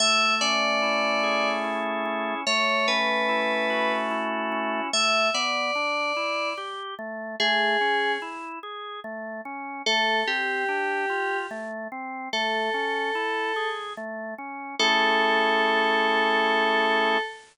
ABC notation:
X:1
M:3/4
L:1/8
Q:1/4=73
K:Amix
V:1 name="Electric Piano 2"
e d3 z2 | c B3 z2 | e d3 z2 | ^G2 z4 |
A G3 z2 | A4 z2 | A6 |]
V:2 name="Drawbar Organ"
A, C E ^G E C | A, C E F E C | A, B, D E G A, | A, C E ^G A, C |
A, =C D =F A, C | A, C E ^G A, C | [A,CE^G]6 |]